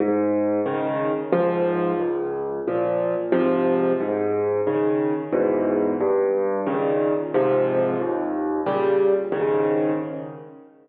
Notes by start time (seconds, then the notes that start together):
0.00 G#2
0.66 C#3 D#3
1.33 C#2 G#2 F3
2.00 C#2
2.68 A#2 F3
3.32 G#2 C3 F3
4.00 G#2
4.67 C#3 D#3
5.33 E2 G#2 B2
6.00 G2
6.67 A#2 C#3 D#3
7.34 G#2 C3 F3
8.00 D#2
8.66 A#2 C#3 G3
9.32 G#2 C#3 D#3